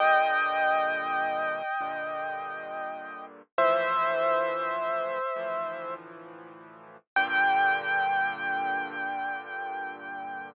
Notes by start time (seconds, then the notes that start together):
0.00 G2 A#2 D3 D#5 G5
1.80 G2 A#2 D3
3.58 D2 A2 E3 F3 C5 E5
5.36 D2 A2 E3 F3
7.16 G2 A#2 D3 G5